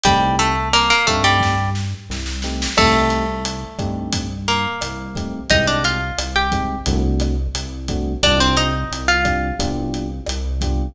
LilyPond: <<
  \new Staff \with { instrumentName = "Acoustic Guitar (steel)" } { \time 4/4 \key c \minor \tempo 4 = 88 <g g'>8 <a a'>8 <bes bes'>16 <bes bes'>16 <a a'>16 <g g'>8. r4. | <a a'>2 r8 <bes bes'>4. | <ees' ees''>16 <d' d''>16 <f' f''>8. <g' g''>8. r2 | <d' d''>16 <c' c''>16 <ees' ees''>8. <f' f''>8. r2 | }
  \new Staff \with { instrumentName = "Electric Piano 1" } { \time 4/4 \key c \minor <a c' ees' g'>4. <a c' ees' g'>2 <a c' ees' g'>8 | <a c' ees' g'>4. <a c' ees' g'>2 <a c' ees' g'>8 | <aes c' ees' g'>4. <aes c' ees' g'>8 <a c' d' fis'>4. <a c' d' fis'>8 | <c' d' f' g'>4. <c' d' f' g'>8 <b d' f' g'>4. <b d' f' g'>8 | }
  \new Staff \with { instrumentName = "Synth Bass 1" } { \clef bass \time 4/4 \key c \minor c,4. g,4. c,4 | c,4. g,4. c,4 | c,4 c,4 c,4 c,4 | c,4 c,4 c,4 c,4 | }
  \new DrumStaff \with { instrumentName = "Drums" } \drummode { \time 4/4 <hh bd>8 hh8 <hh ss>8 <hh bd>8 <bd sn>8 sn8 sn16 sn16 sn16 sn16 | <cymc bd ss>8 hh8 hh8 <hh bd ss>8 <hh bd>8 hh8 <hh ss>8 <hh bd>8 | <hh bd>8 hh8 <hh ss>8 <hh bd>8 <hh bd>8 <hh ss>8 hh8 <hh bd>8 | <hh bd ss>8 hh8 hh8 <hh bd ss>8 <hh bd>8 hh8 <hh ss>8 <hh bd>8 | }
>>